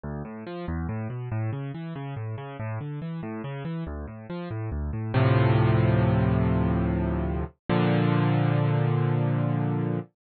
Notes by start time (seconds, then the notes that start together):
0.04 D2
0.25 A2
0.47 F3
0.68 E2
0.89 A2
1.10 B2
1.32 A2
1.53 C#3
1.74 E3
1.96 C#3
2.16 A2
2.38 C#3
2.60 A2
2.81 D3
3.02 E3
3.23 A2
3.44 C#3
3.65 E3
3.87 D2
4.08 A2
4.30 F3
4.51 A2
4.72 D2
4.93 A2
5.14 D2 A2 C3 F3
7.70 A#2 D3 F3